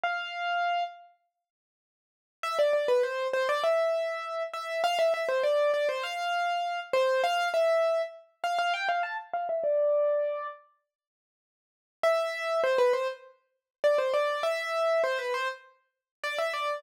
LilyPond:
\new Staff { \time 4/4 \key c \major \tempo 4 = 100 f''4. r2 r8 | e''16 d''16 d''16 b'16 c''8 c''16 d''16 e''4. e''8 | f''16 e''16 e''16 c''16 d''8 d''16 c''16 f''4. c''8 | f''8 e''4 r8 f''16 f''16 g''16 f''16 a''16 r16 f''16 e''16 |
d''4. r2 r8 | e''4 c''16 b'16 c''16 r4 r16 d''16 c''16 d''8 | e''4 c''16 b'16 c''16 r4 r16 d''16 e''16 d''8 | }